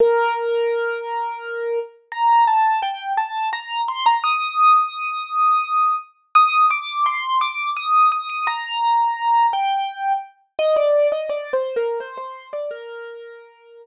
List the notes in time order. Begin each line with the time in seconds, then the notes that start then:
0.00 A#4
2.12 A#5
2.47 A5
2.82 G5
3.17 A5
3.53 A#5
3.88 C6
4.06 A#5
4.24 D#6
6.35 D#6
6.70 D6
7.06 C6
7.41 D6
7.76 D#6
8.12 D#6
8.29 D#6
8.47 A#5
9.53 G5
10.59 D#5
10.76 D5
11.12 D#5
11.29 D5
11.53 C5
11.76 A#4
12.00 C5
12.17 C5
12.53 D5
12.71 A#4